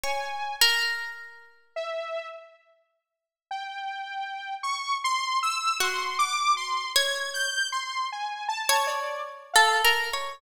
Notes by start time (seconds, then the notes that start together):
0.04 C#5 G#5
0.61 A#4
1.76 E5
3.51 G5
4.63 C#6
5.04 C6
5.43 E6
5.80 F#4 C6
6.19 D6
6.57 C6
6.96 C#5 G#6
7.34 G6
7.72 C6
8.12 G#5
8.49 A5
8.69 C#5
8.87 D5
9.54 A4 F5
9.85 A#4
10.13 C#5